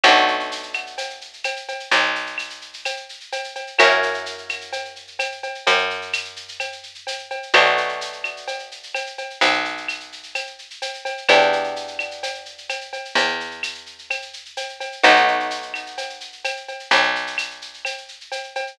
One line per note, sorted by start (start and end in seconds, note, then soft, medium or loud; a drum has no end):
0.04 1.76 B1 loud
0.04 3.72 A3 loud
0.04 3.72 B3 medium
0.04 3.72 D4 medium
0.04 3.72 F#4 loud
0.04 cowbell medium
0.04 claves loud
0.04 shaker loud
0.16 shaker medium
0.28 shaker medium
0.40 shaker medium
0.51 shaker loud
0.63 shaker medium
0.74 claves medium
0.74 shaker medium
0.87 shaker medium
0.98 cowbell medium
0.98 shaker loud
1.10 shaker medium
1.21 shaker medium
1.33 shaker medium
1.44 cowbell medium
1.44 claves medium
1.44 shaker loud
1.56 shaker medium
1.68 cowbell medium
1.68 shaker medium
1.80 shaker medium
1.91 3.64 B1 medium
1.91 cowbell medium
1.91 shaker loud
2.03 shaker medium
2.15 shaker medium
2.27 shaker medium
2.38 claves medium
2.38 shaker medium
2.50 shaker medium
2.61 shaker medium
2.74 shaker medium
2.85 cowbell medium
2.85 claves medium
2.85 shaker loud
2.97 shaker medium
3.09 shaker medium
3.20 shaker medium
3.32 cowbell medium
3.32 shaker loud
3.44 shaker medium
3.55 cowbell medium
3.55 shaker medium
3.67 shaker medium
3.79 5.52 F#2 medium
3.79 7.47 A#3 medium
3.79 7.47 C#4 medium
3.79 7.47 E4 medium
3.79 7.47 F#4 medium
3.79 cowbell medium
3.79 claves loud
3.79 shaker loud
3.90 shaker medium
4.03 shaker medium
4.14 shaker medium
4.26 shaker loud
4.38 shaker medium
4.49 claves medium
4.49 shaker loud
4.61 shaker medium
4.73 cowbell medium
4.73 shaker loud
4.85 shaker medium
4.96 shaker medium
5.07 shaker medium
5.19 cowbell medium
5.19 claves medium
5.19 shaker loud
5.32 shaker medium
5.43 cowbell medium
5.43 shaker medium
5.55 shaker medium
5.67 7.40 F#2 medium
5.67 cowbell loud
5.67 shaker loud
5.78 shaker medium
5.90 shaker medium
6.02 shaker medium
6.13 claves loud
6.13 shaker loud
6.25 shaker medium
6.36 shaker medium
6.48 shaker medium
6.60 cowbell medium
6.60 claves medium
6.60 shaker loud
6.72 shaker medium
6.83 shaker medium
6.95 shaker medium
7.07 cowbell medium
7.07 shaker loud
7.19 shaker medium
7.30 cowbell medium
7.30 shaker medium
7.43 shaker medium
7.54 9.26 B1 medium
7.54 11.22 A3 medium
7.54 11.22 B3 medium
7.54 11.22 D4 loud
7.54 11.22 F#4 medium
7.54 cowbell medium
7.54 claves loud
7.54 shaker loud
7.66 shaker medium
7.77 shaker medium
7.89 shaker medium
8.01 shaker loud
8.13 shaker medium
8.24 claves medium
8.24 shaker medium
8.37 shaker medium
8.48 cowbell medium
8.48 shaker medium
8.59 shaker medium
8.71 shaker medium
8.83 shaker medium
8.95 cowbell medium
8.95 claves medium
8.95 shaker loud
9.06 shaker medium
9.18 cowbell medium
9.18 shaker medium
9.30 shaker medium
9.41 11.14 B1 medium
9.41 cowbell loud
9.41 shaker loud
9.53 shaker medium
9.65 shaker medium
9.77 shaker medium
9.88 claves medium
9.88 shaker loud
10.00 shaker medium
10.12 shaker medium
10.23 shaker medium
10.35 cowbell medium
10.35 claves medium
10.35 shaker loud
10.47 shaker medium
10.59 shaker medium
10.70 shaker medium
10.82 cowbell medium
10.82 shaker loud
10.94 shaker medium
11.05 cowbell medium
11.05 shaker medium
11.17 shaker medium
11.29 13.01 E2 medium
11.29 14.97 B3 medium
11.29 14.97 D4 medium
11.29 14.97 E4 medium
11.29 14.97 G4 medium
11.29 cowbell loud
11.29 claves loud
11.29 shaker loud
11.41 shaker medium
11.53 shaker medium
11.64 shaker medium
11.76 shaker medium
11.88 shaker medium
11.99 claves medium
11.99 shaker medium
12.11 shaker medium
12.23 cowbell medium
12.23 shaker loud
12.35 shaker medium
12.46 shaker medium
12.58 shaker medium
12.69 cowbell medium
12.69 claves medium
12.69 shaker loud
12.81 shaker medium
12.93 cowbell medium
12.93 shaker medium
13.05 shaker medium
13.15 14.88 E2 medium
13.15 cowbell medium
13.15 shaker loud
13.28 shaker medium
13.40 shaker medium
13.51 shaker medium
13.63 claves medium
13.63 shaker loud
13.75 shaker medium
13.86 shaker medium
13.99 shaker medium
14.10 cowbell medium
14.10 claves loud
14.10 shaker loud
14.22 shaker medium
14.33 shaker medium
14.45 shaker medium
14.57 cowbell medium
14.57 shaker loud
14.69 shaker medium
14.80 cowbell medium
14.80 shaker medium
14.92 shaker medium
15.04 16.77 B1 medium
15.04 18.71 A3 loud
15.04 18.71 B3 medium
15.04 18.71 D#4 medium
15.04 18.71 F#4 medium
15.04 cowbell loud
15.04 claves loud
15.04 shaker loud
15.16 shaker medium
15.28 shaker medium
15.40 shaker medium
15.50 shaker loud
15.62 shaker medium
15.74 claves medium
15.74 shaker medium
15.86 shaker medium
15.98 cowbell medium
15.98 shaker loud
16.10 shaker medium
16.20 shaker medium
16.32 shaker medium
16.44 cowbell medium
16.44 claves medium
16.44 shaker loud
16.57 shaker medium
16.68 cowbell medium
16.68 shaker medium
16.79 shaker medium
16.91 18.64 B1 medium
16.91 cowbell loud
16.91 shaker loud
17.03 shaker medium
17.16 shaker medium
17.27 shaker medium
17.38 claves loud
17.38 shaker loud
17.50 shaker medium
17.62 shaker medium
17.74 shaker medium
17.85 cowbell medium
17.85 claves medium
17.85 shaker loud
17.98 shaker medium
18.08 shaker medium
18.21 shaker medium
18.32 cowbell medium
18.32 shaker loud
18.44 shaker medium
18.55 cowbell medium
18.55 shaker medium
18.67 shaker medium